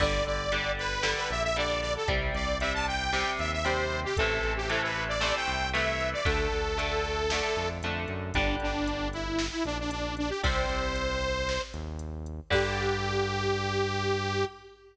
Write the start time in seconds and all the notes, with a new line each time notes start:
0.00 G1 D3 G3 D5, kick, crash
0.26 G1 D5, closed hi-hat
0.52 D3 G3, closed hi-hat
0.78 B4, closed hi-hat
1.02 D3 G3, snare
1.17 B4
1.30 A#1 E5, closed hi-hat
1.44 E5
1.56 D3 G3 D5, closed hi-hat
1.81 D5, open hi-hat
1.96 A4
2.08 C2 C3 G3, kick, closed hi-hat
2.34 C2 D5, closed hi-hat
2.60 C3 G3 E5, closed hi-hat
2.74 A5
2.87 G5, closed hi-hat
3.12 C3 G3, snare
3.39 D#2 E5, closed hi-hat
3.52 E5
3.64 C3 G3 C5, closed hi-hat
3.92 closed hi-hat
4.04 G4
4.17 A1 C3 E3 A3 A4, kick, closed hi-hat
4.43 A1, closed hi-hat
4.57 G4
4.69 C3 E3 A3 A4, closed hi-hat
4.83 B4
4.95 closed hi-hat
5.08 D5
5.20 C3 E3 A3 D5, snare
5.36 G5
5.48 C2, closed hi-hat
5.73 C3 E3 A3 E5, closed hi-hat
6.01 closed hi-hat
6.13 D5
6.25 D2 D3 A3 A4, kick, closed hi-hat
6.52 D2, closed hi-hat
6.78 D3 A3, closed hi-hat
7.05 closed hi-hat
7.30 D3 A3, snare
7.56 F2, closed hi-hat
7.83 F2 D3 A3, closed hi-hat
8.08 F#2, closed hi-hat
8.34 G1 D3 G3 D4, kick, closed hi-hat
8.60 G1 D4, closed hi-hat
8.87 closed hi-hat
9.13 E4, closed hi-hat
9.39 snare
9.52 E4
9.64 A#1 D4, closed hi-hat
9.79 D4
9.91 D4, closed hi-hat
10.17 D4, closed hi-hat
10.29 G4
10.43 C2 C3 G3 C5, kick, closed hi-hat
10.69 C2, closed hi-hat
10.96 closed hi-hat
11.22 closed hi-hat
11.49 snare
11.74 D#2, closed hi-hat
11.99 closed hi-hat
12.26 closed hi-hat
12.50 G2 D3 G3 G4, kick, crash